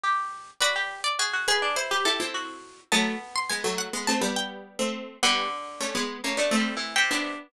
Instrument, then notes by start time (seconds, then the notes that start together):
pizzicato strings
0.03 G4
0.60 F#4 B4 D5
0.76 G4
1.04 D5
1.19 F#4 G#4
1.33 F#4
1.48 G#4 B4
1.62 D4
1.76 E4 C5
1.91 G4 B4
2.05 E4 G4 A4
2.20 C4 E4
2.34 F#4
2.92 F#3 A3 B3 A5
3.36 C6
3.50 G#3 B3 G#5
3.64 F#3 A3
3.78 F#5
3.93 G#3 B3
4.07 A3 C4 A5
4.21 G3 B3
4.36 G5
4.79 A3 C4
5.23 D3 G3 B3 F#5
5.81 A3 C#4
5.95 G#3 B3
6.24 A3 A#3 C#4
6.37 A3 B3 D4
6.51 A3 C4
6.57 G3
6.77 E3
6.96 C3 G5
7.11 B3 D4